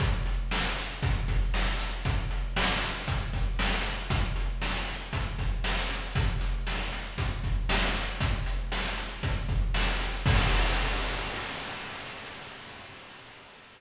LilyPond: \new DrumStaff \drummode { \time 4/4 \tempo 4 = 117 <hh bd>8 hh8 sn8 hh8 <hh bd>8 <hh bd>8 sn8 hh8 | <hh bd>8 hh8 sn8 hh8 <hh bd>8 <hh bd>8 sn8 hh8 | <hh bd>8 hh8 sn8 hh8 <hh bd>8 <hh bd>8 sn8 hh8 | <hh bd>8 hh8 sn8 hh8 <hh bd>8 <hh bd>8 sn8 hh8 |
<hh bd>8 hh8 sn8 hh8 <hh bd>8 <hh bd>8 sn8 hh8 | <cymc bd>4 r4 r4 r4 | }